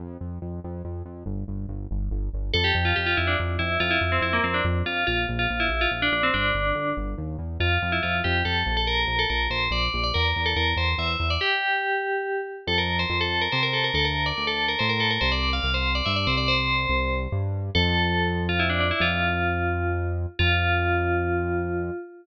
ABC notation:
X:1
M:3/4
L:1/16
Q:1/4=142
K:F
V:1 name="Tubular Bells"
z12 | z12 | A G2 F G F E D z2 E2 | F E2 C E B, C D z2 F2 |
F z2 F2 E2 F z D D C | D6 z6 | F3 E F2 G2 A3 A | B3 A B2 c2 d3 d |
B3 A B2 c2 e3 d | G10 z2 | A B2 c2 A2 B c B A B | A B2 d2 A2 B c B A B |
c d2 f2 c2 d e d c d | c6 z6 | A6 z F E D D E | "^rit." F10 z2 |
F12 |]
V:2 name="Synth Bass 1" clef=bass
F,,2 F,,2 F,,2 F,,2 F,,2 F,,2 | G,,,2 G,,,2 G,,,2 G,,,2 G,,,2 G,,,2 | F,,2 F,,2 F,,2 F,,2 F,,2 F,,2 | F,,2 F,,2 F,,2 F,,2 F,,2 F,,2 |
B,,,2 B,,,2 B,,,2 B,,,2 B,,,2 B,,,2 | G,,,2 G,,,2 G,,,2 G,,,2 _E,,2 =E,,2 | F,,2 F,,2 F,,2 F,,2 F,,2 B,,,2- | B,,,2 B,,,2 B,,,2 B,,,2 B,,,2 B,,,2 |
E,,2 E,,2 E,,2 E,,2 E,,2 E,,2 | z12 | F,,4 F,,4 C,4 | D,,4 D,,4 A,,4 |
C,,4 C,,4 G,,2 C,,2- | C,,4 C,,4 G,,4 | F,,12 | "^rit." F,,12 |
F,,12 |]